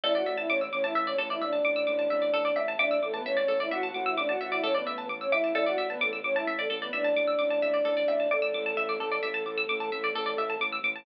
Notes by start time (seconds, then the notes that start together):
0.04 A1 E4 A4 D5 E5
0.15 F#4 D5 F#5
0.26 A1 E5
0.38 E4 E5 A5
0.50 A1 C#4 C#5 D6
0.61 E6
0.73 A1 C#4 C#5 D6
0.84 E4 E5 A5
0.95 A1 E5
1.07 C#4 C#5 D5
1.18 A1 A4
1.30 E4 D5 E5
1.41 A1 D4 D5 E5
1.53 A5
1.65 A1 D6
1.76 E6
1.87 A1 D6
1.99 A5
2.10 A1 E5
2.22 D5
2.33 A1 A4
2.45 D5
2.56 A1 E5
2.68 A5
2.79 A1 D4 D5 E5 D6
2.91 E6
3.01 A1 A3 A4 D6
3.14 B3 B4 A5
3.25 A1 C#4 C#5 E5
3.37 D5
3.48 A1 A4
3.60 E4 D5 E5
3.71 A1 F#4 E5 F#5
3.83 F#4 F#5 A5
3.94 A1 F#4 F#5 D6
4.06 E4 E5 E6
4.17 A1 D4 D5 D6
4.29 F#4 F#5 A5
4.40 A1 F#4 E5 F#5
4.52 E4 D5 E5
4.63 A1 C#4 A4 C#5
4.75 B3 B4 D5
4.87 A1 E5
4.98 A5
5.07 A1 D6
5.21 C#4 C#5 E6
5.32 A1 E4 E5 D6
5.44 A5
5.55 A1 E4 A4 D5 E5
5.66 F#4 D5 F#5
5.77 A1 E5
5.90 B3 B4 A5
6.01 A1 A3 A4 D6
6.13 E6
6.24 A1 C#4 C#5 D6
6.36 E4 E5 A5
6.47 A1 E5
6.59 A3 A4 D5
6.70 A1 A4
6.82 B3 B4 D5
6.93 A1 D4 D5 E5
7.04 A5
7.16 A1 D6
7.27 E6
7.39 A1 D6
7.50 A5
7.62 A1 E5
7.74 D5
7.85 A1 A4
7.97 D5
8.08 A1 E5
8.20 A5
8.31 A1 A3 A4 D5 D6
8.42 E6
8.54 A1 D6
8.66 A5
8.77 A1 E5
8.89 D5
9.00 A1 A4
9.12 D5
9.23 A1 E5
9.34 A5
9.45 A1 D6
9.58 E6
9.69 A1 D6
9.80 A5
9.92 A1 E5
10.04 D5
10.15 A1 A4
10.26 D5
10.37 A1 E5
10.50 A5
10.60 A1 D6
10.73 E6
10.83 A1 D6
10.96 A5